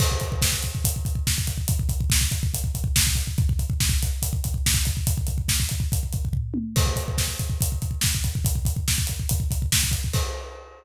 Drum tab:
CC |x---------------|----------------|----------------|----------------|
HH |--x---x-x-x---x-|x-x---x-x-x---x-|x-x---x-x-x---x-|x-x---x-x-x-----|
SD |----o-------o---|----o-------o---|----o-------o---|----o-----------|
T1 |----------------|----------------|----------------|--------------o-|
FT |----------------|----------------|----------------|------------o---|
BD |oooooooooooooooo|oooooooooooooooo|ooooooo-oooooooo|ooooooooooooo---|

CC |x---------------|----------------|x---------------|
HH |--x---x-x-x---x-|x-x---x-x-x---x-|----------------|
SD |----o-------o---|----o-------o---|----------------|
T1 |----------------|----------------|----------------|
FT |----------------|----------------|----------------|
BD |oooooooooooooooo|oooooooooooooooo|o---------------|